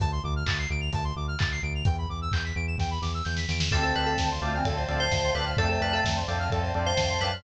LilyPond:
<<
  \new Staff \with { instrumentName = "Electric Piano 2" } { \time 4/4 \key d \dorian \tempo 4 = 129 r1 | r1 | a'16 a'16 b'16 a'16 r4. r16 c''8. b'16 r16 | a'16 a'16 b'16 a'16 r4. r16 c''8. b'16 r16 | }
  \new Staff \with { instrumentName = "Choir Aahs" } { \time 4/4 \key d \dorian r1 | r1 | <c' a'>4. <a f'>16 <e c'>16 <a, f>8 <a, f>4. | <c a>4. <a, f>16 <a, f>16 <a, f>8 <a, f>4. | }
  \new Staff \with { instrumentName = "Drawbar Organ" } { \time 4/4 \key d \dorian r1 | r1 | <c' d' f' a'>8 <c' d' f' a'>4 <c' d' f' a'>4 <c' d' f' a'>4 <c' d' f' a'>8 | <c' d' f' a'>8 <c' d' f' a'>4 <c' d' f' a'>4 <c' d' f' a'>4 <c' d' f' a'>8 | }
  \new Staff \with { instrumentName = "Lead 1 (square)" } { \time 4/4 \key d \dorian a''16 c'''16 d'''16 f'''16 a'''16 c''''16 d''''16 f''''16 a''16 c'''16 d'''16 f'''16 a'''16 c''''16 d''''16 f''''16 | g''16 b''16 d'''16 e'''16 g'''16 b'''16 d''''16 e''''16 g''16 b''16 d'''16 e'''16 g'''16 b'''16 d''''16 e''''16 | a'16 c''16 d''16 f''16 a''16 c'''16 d'''16 f'''16 a'16 c''16 d''16 f''16 a''16 c'''16 d'''16 f'''16 | a'16 c''16 d''16 f''16 a''16 c'''16 d'''16 f'''16 a'16 c''16 d''16 f''16 a''16 c'''16 d'''16 f'''16 | }
  \new Staff \with { instrumentName = "Synth Bass 1" } { \clef bass \time 4/4 \key d \dorian d,8 d,8 d,8 d,8 d,8 d,8 d,8 d,8 | e,8 e,8 e,8 e,8 e,8 e,8 e,8 e,8 | d,8 d,8 d,8 d,8 d,8 d,8 d,8 d,8 | f,8 f,8 f,8 f,8 f,8 f,8 f,8 fis,8 | }
  \new Staff \with { instrumentName = "String Ensemble 1" } { \time 4/4 \key d \dorian r1 | r1 | <c'' d'' f'' a''>2 <c'' d'' a'' c'''>2 | <c'' d'' f'' a''>2 <c'' d'' a'' c'''>2 | }
  \new DrumStaff \with { instrumentName = "Drums" } \drummode { \time 4/4 <hh bd>4 <hc bd>4 <hh bd>4 <hc bd>4 | <hh bd>4 <hc bd>4 <bd sn>8 sn8 sn16 sn16 sn16 sn16 | <cymc bd>8 cymr8 <bd sn>8 cymr8 <bd cymr>8 cymr8 <bd sn>8 cymr8 | <bd cymr>8 cymr8 <bd sn>8 cymr8 <bd cymr>8 cymr8 <bd sn>8 cymr8 | }
>>